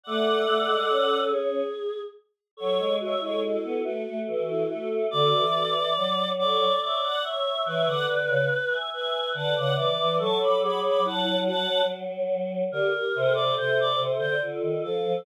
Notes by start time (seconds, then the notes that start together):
0.04 A3 A4 D5 F#5
0.47 A3
0.68 G#3
0.90 C#4
1.30 G#4
2.57 F#3 A4 C#5
2.79 G#3
3.01 F#4 C#5 E5
3.20 G#3 E4 A4 C#5
3.42 E4 F#4 A4
3.64 B3
3.84 A3 F#4
4.07 A3
4.27 E3 F#4 A4
4.50 E4
4.68 A3 F#4 A4
5.10 D3 F#4 A4 D5
5.35 E3
5.55 F#4 A4
5.96 F#3
6.38 A4 C#5 D5
6.81 C#5 D5 E5
7.04 D5 F#5
7.23 C#5 E5
7.66 E3 B4 C#5 E5
7.86 D3 D5 F#5
8.09 D3
8.28 C#3
8.70 E5 G#5
8.92 B4 E5 G#5
9.34 D3 B4 F#5 A5
9.55 C#3 D5 F#5
9.75 E3 B4 D5
9.98 E3
10.19 F#3 A4 A5 C#6
10.39 A4 B5 D6
10.60 G#4 B5 D6
10.83 G#4 B5 D6
11.04 E4 F#5 A5
11.24 E4
11.45 F#4 F#5 A5
12.71 D3 G4 A#4
12.93 G4 A#4
13.15 C3 A4 C5
13.34 A4 C5 D5
13.55 C3 A4 C5
13.80 D5
13.97 C3
14.19 D3 C5
14.42 D3 F4 A4
14.62 D#3
14.83 F3 A4
15.04 F3